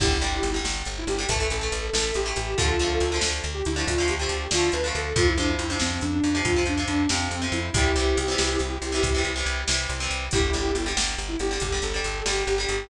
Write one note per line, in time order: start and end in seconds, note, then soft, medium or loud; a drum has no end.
0.00 0.18 G1 loud
0.00 0.17 D3 medium
0.00 0.17 G3 medium
0.00 0.51 E4 medium
0.00 0.51 G4 loud
0.00 kick loud
0.00 crash loud
0.21 0.40 G1 medium
0.21 0.48 D3 medium
0.21 0.48 G3 medium
0.21 closed hi-hat medium
0.43 0.61 G1 medium
0.43 closed hi-hat medium
0.54 0.89 D3 medium
0.54 0.89 G3 medium
0.64 0.83 G1 medium
0.64 snare loud
0.85 1.05 G1 medium
0.85 closed hi-hat medium
0.98 1.09 E4 loud
1.07 1.25 G1 medium
1.07 1.26 G4 loud
1.07 closed hi-hat medium
1.18 1.27 D3 medium
1.18 1.27 G3 medium
1.28 1.47 A1 medium
1.28 1.38 E3 medium
1.28 1.38 A3 medium
1.28 1.46 A4 loud
1.28 kick medium
1.28 closed hi-hat loud
1.40 1.57 E3 medium
1.40 1.57 A3 medium
1.50 1.69 A1 medium
1.50 1.87 A4 medium
1.50 closed hi-hat medium
1.61 1.87 E3 medium
1.61 1.87 A3 medium
1.72 1.90 A1 medium
1.72 closed hi-hat medium
1.93 2.12 A1 medium
1.93 2.19 E3 medium
1.93 2.19 A3 medium
1.93 2.11 A4 loud
1.93 snare loud
2.14 2.34 A1 medium
2.14 2.35 G4 medium
2.14 closed hi-hat medium
2.26 2.52 E3 medium
2.26 2.52 A3 medium
2.36 2.55 A1 medium
2.36 2.57 G4 loud
2.36 closed hi-hat medium
2.57 2.77 D2 medium
2.57 2.75 D3 medium
2.57 2.75 F3 medium
2.57 3.17 F4 medium
2.57 3.17 A4 loud
2.57 kick loud
2.57 closed hi-hat loud
2.61 2.75 A3 medium
2.79 2.98 D2 medium
2.79 3.05 D3 medium
2.79 3.05 F3 medium
2.79 closed hi-hat medium
2.83 3.05 A3 medium
3.00 3.19 D2 medium
3.00 closed hi-hat medium
3.12 3.46 D3 medium
3.12 3.46 F3 medium
3.12 3.46 A3 medium
3.21 3.41 D2 medium
3.21 snare loud
3.44 3.62 D2 medium
3.44 closed hi-hat medium
3.54 3.64 G4 medium
3.65 3.84 D2 medium
3.65 3.83 E4 medium
3.65 closed hi-hat medium
3.76 3.93 D3 medium
3.76 3.93 F3 medium
3.76 3.93 A3 medium
3.87 4.06 D2 loud
3.87 4.08 F4 loud
3.87 kick medium
3.87 closed hi-hat loud
3.98 4.15 D3 medium
3.98 4.15 F3 medium
3.98 4.15 A3 medium
4.08 4.27 D2 medium
4.08 4.46 G4 medium
4.08 closed hi-hat medium
4.19 4.45 D3 medium
4.19 4.45 F3 medium
4.19 4.45 A3 medium
4.29 4.48 D2 medium
4.29 closed hi-hat medium
4.51 4.70 D2 medium
4.51 4.78 D3 medium
4.51 4.78 F3 medium
4.51 4.71 F4 loud
4.51 snare loud
4.56 4.78 A3 medium
4.72 4.91 D2 medium
4.72 4.93 B4 loud
4.72 closed hi-hat medium
4.84 5.10 D3 medium
4.84 5.10 F3 medium
4.84 5.10 A3 medium
4.95 5.13 D2 medium
4.95 5.15 A4 loud
4.95 closed hi-hat medium
5.16 5.34 F2 loud
5.16 5.33 C3 medium
5.16 5.33 F3 medium
5.16 5.27 F4 loud
5.16 kick loud
5.16 closed hi-hat loud
5.28 5.38 E4 loud
5.38 5.56 F2 medium
5.38 5.64 C3 medium
5.38 5.64 F3 medium
5.38 5.49 D4 loud
5.38 closed hi-hat medium
5.49 5.58 E4 medium
5.59 5.77 F2 medium
5.59 5.69 E4 medium
5.59 closed hi-hat medium
5.70 6.04 C3 medium
5.70 6.04 F3 medium
5.70 5.80 D4 medium
5.80 5.99 F2 medium
5.80 6.01 C4 loud
5.80 snare loud
6.01 6.20 F2 medium
6.01 6.12 D4 medium
6.01 closed hi-hat medium
6.13 6.23 D4 loud
6.24 6.42 F2 medium
6.24 6.42 D4 medium
6.24 closed hi-hat medium
6.35 6.52 C3 medium
6.35 6.52 F3 medium
6.45 6.63 F2 medium
6.45 6.62 F4 medium
6.45 kick medium
6.45 closed hi-hat medium
6.56 6.73 C3 medium
6.56 6.73 F3 medium
6.66 6.85 F2 medium
6.66 6.88 D4 medium
6.66 closed hi-hat medium
6.78 7.03 C3 medium
6.78 7.03 F3 medium
6.87 7.06 F2 medium
6.87 7.07 D4 medium
6.87 closed hi-hat medium
7.09 7.28 F2 medium
7.09 7.36 C3 medium
7.09 7.36 F3 medium
7.09 7.45 C4 loud
7.09 snare loud
7.31 7.49 F2 medium
7.31 closed hi-hat medium
7.42 7.67 C3 medium
7.42 7.67 F3 medium
7.52 7.70 F2 medium
7.52 7.72 E4 medium
7.52 closed hi-hat medium
7.74 7.92 C2 loud
7.74 7.91 C3 medium
7.74 7.91 E3 medium
7.74 7.91 G3 medium
7.74 9.24 E4 medium
7.74 9.24 G4 loud
7.74 kick loud
7.74 closed hi-hat loud
7.96 8.14 C2 medium
7.96 8.21 C3 medium
7.96 8.21 E3 medium
7.96 8.21 G3 medium
7.96 closed hi-hat medium
8.17 8.35 C2 medium
8.17 closed hi-hat medium
8.28 8.62 C3 medium
8.28 8.62 E3 medium
8.28 8.62 G3 medium
8.38 8.57 C2 medium
8.38 snare loud
8.59 8.78 C2 medium
8.59 closed hi-hat medium
8.82 9.00 C2 medium
8.82 closed hi-hat medium
8.92 9.09 C3 medium
8.92 9.09 E3 medium
8.92 9.09 G3 medium
9.03 9.21 C2 medium
9.03 kick medium
9.03 closed hi-hat loud
9.15 9.32 C3 medium
9.15 9.32 E3 medium
9.15 9.32 G3 medium
9.24 9.43 C2 medium
9.24 closed hi-hat medium
9.36 9.61 C3 medium
9.36 9.61 E3 medium
9.36 9.61 G3 medium
9.46 9.64 C2 medium
9.46 closed hi-hat medium
9.67 9.87 C2 medium
9.67 9.93 C3 medium
9.67 9.93 E3 medium
9.67 9.93 G3 medium
9.67 snare loud
9.89 10.08 C2 medium
9.89 closed hi-hat medium
10.00 10.26 C3 medium
10.00 10.26 E3 medium
10.00 10.26 G3 medium
10.10 10.29 C2 medium
10.10 closed hi-hat medium
10.31 10.51 G1 loud
10.31 10.50 D3 medium
10.31 10.50 G3 medium
10.31 10.89 E4 loud
10.31 10.89 G4 loud
10.31 kick loud
10.31 closed hi-hat medium
10.53 10.72 G1 medium
10.53 10.79 D3 medium
10.53 10.79 G3 medium
10.53 closed hi-hat medium
10.75 10.93 G1 medium
10.75 closed hi-hat medium
10.86 11.20 D3 medium
10.86 11.20 G3 medium
10.97 11.15 G1 medium
10.97 snare loud
11.18 11.37 G1 medium
11.18 closed hi-hat medium
11.28 11.39 E4 medium
11.39 11.58 G1 medium
11.39 11.59 G4 medium
11.39 closed hi-hat medium
11.51 11.68 D3 medium
11.51 11.68 G3 medium
11.60 11.80 G1 medium
11.60 11.82 G4 medium
11.60 kick medium
11.60 closed hi-hat medium
11.72 11.89 D3 medium
11.72 11.89 G3 medium
11.82 12.01 G1 medium
11.82 12.22 A4 medium
11.82 closed hi-hat medium
11.94 12.20 D3 medium
11.94 12.20 G3 medium
12.04 12.23 G1 medium
12.04 closed hi-hat medium
12.25 12.44 G1 medium
12.25 12.52 D3 medium
12.25 12.52 G3 medium
12.25 12.43 G4 medium
12.25 snare loud
12.47 12.66 G1 loud
12.47 12.66 G4 medium
12.47 closed hi-hat medium
12.58 12.84 D3 medium
12.58 12.84 G3 medium
12.69 12.87 G1 medium
12.69 12.87 G4 medium
12.69 closed hi-hat medium